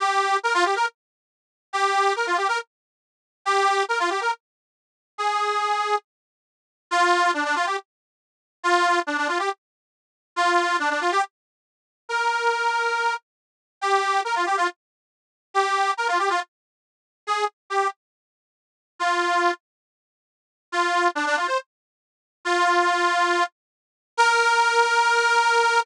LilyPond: \new Staff { \time 4/4 \key ees \mixolydian \tempo 4 = 139 g'4 bes'16 f'16 g'16 bes'16 r2 | g'4 bes'16 f'16 g'16 bes'16 r2 | g'4 bes'16 f'16 g'16 bes'16 r2 | aes'2 r2 |
\key bes \mixolydian f'4 d'16 d'16 f'16 g'16 r2 | f'4 d'16 d'16 f'16 g'16 r2 | f'4 d'16 d'16 f'16 g'16 r2 | bes'2~ bes'8 r4. |
\key ees \mixolydian g'4 bes'16 f'16 g'16 f'16 r2 | g'4 bes'16 f'16 g'16 f'16 r2 | aes'8 r8 g'8 r2 r8 | f'4. r2 r8 |
\key bes \mixolydian f'4 d'16 d'16 f'16 c''16 r2 | f'2~ f'8 r4. | bes'1 | }